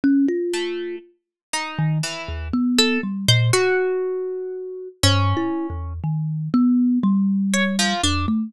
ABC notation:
X:1
M:5/8
L:1/16
Q:1/4=60
K:none
V:1 name="Kalimba"
^C F3 | z3 ^D, z ^D,, B,2 G, ^A,, | ^F6 (3G,,2 E2 E,,2 | ^D,2 B,2 G,4 F,, A, |]
V:2 name="Orchestral Harp"
z2 A,2 | z2 ^D2 E,2 z A z c | ^F6 ^C4 | z6 ^c F, D z |]